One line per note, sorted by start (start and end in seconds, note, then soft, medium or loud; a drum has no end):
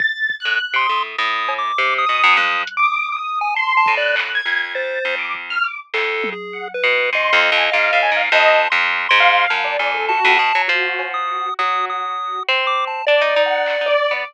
0.00 0.35 A6 loud
0.00 kick loud
0.30 kick medium
0.40 0.76 F#6 loud
0.45 0.59 A2 medium
0.74 0.87 C3 medium
0.74 1.03 C6 loud
0.79 1.14 D#6 medium
0.89 1.16 A2 medium
1.18 1.72 A2 medium
1.18 1.54 D#6 medium
1.49 cowbell loud
1.58 1.94 D6 loud
1.78 2.05 C3 medium
1.98 2.34 D#6 loud
2.06 2.22 B2 medium
2.06 2.33 D#6 loud
2.24 2.37 F#2 loud
2.36 2.64 F2 loud
2.36 2.62 D#6 medium
2.36 2.73 F#6 medium
2.36 high tom medium
2.67 closed hi-hat loud
2.77 3.13 D6 loud
2.83 3.10 D#6 medium
3.12 3.39 D#6 medium
3.17 3.52 D#6 medium
3.41 3.54 G#5 loud
3.55 3.73 A5 medium
3.55 3.92 C6 loud
3.77 3.95 A5 loud
3.86 4.41 A2 medium
3.86 kick loud
3.96 4.15 D5 loud
3.96 4.32 F#6 loud
4.16 clap loud
4.35 4.71 G#6 loud
4.45 4.99 F2 soft
4.75 5.15 C5 medium
4.75 5.15 A6 medium
5.05 5.58 F2 medium
5.19 5.32 D6 medium
5.35 kick medium
5.50 5.64 F6 loud
5.64 5.77 D6 medium
5.94 6.34 F2 medium
5.94 6.30 A4 medium
5.94 clap medium
6.24 high tom loud
6.32 6.68 G#4 medium
6.53 6.67 F#5 medium
6.74 7.10 B4 medium
6.84 7.10 B2 medium
7.13 7.30 G#2 medium
7.13 8.22 D#5 medium
7.13 7.53 C6 medium
7.33 7.50 F2 loud
7.52 7.70 F2 loud
7.57 7.70 G#5 medium
7.72 7.91 G#2 medium
7.72 7.98 F5 loud
7.93 8.11 A2 medium
8.03 8.16 G#5 loud
8.12 8.29 G#2 medium
8.17 8.30 F5 loud
8.32 8.68 F2 loud
8.32 8.59 D#5 loud
8.32 8.69 A5 loud
8.70 9.07 F2 loud
8.70 9.06 C6 medium
9.09 9.46 G#2 loud
9.09 9.45 C6 loud
9.20 9.60 F5 loud
9.50 9.77 F#2 medium
9.50 9.77 A5 medium
9.50 snare medium
9.64 9.91 D5 medium
9.79 10.19 F2 medium
9.79 10.06 G#5 medium
9.94 10.08 A4 medium
10.09 10.36 F#4 loud
10.09 10.62 A5 loud
10.25 10.38 F2 loud
10.39 10.52 B2 medium
10.55 10.68 F#3 medium
10.68 11.49 F3 loud
10.68 11.48 F#4 medium
10.68 closed hi-hat medium
10.99 cowbell medium
11.14 11.54 D#6 medium
11.59 12.39 F#3 medium
11.59 12.40 F#4 medium
11.59 11.86 D#6 loud
11.90 12.43 D#6 medium
12.49 13.02 C4 medium
12.49 12.66 C6 medium
12.67 12.85 D6 loud
12.87 13.05 A5 medium
13.07 13.21 D4 medium
13.07 13.42 D5 medium
13.07 14.13 D5 loud
13.21 13.35 D#4 loud
13.36 13.76 D#4 medium
13.46 13.82 F#5 medium
13.66 clap medium
13.81 13.95 D#4 medium
13.86 14.22 D5 loud
14.11 14.24 B3 medium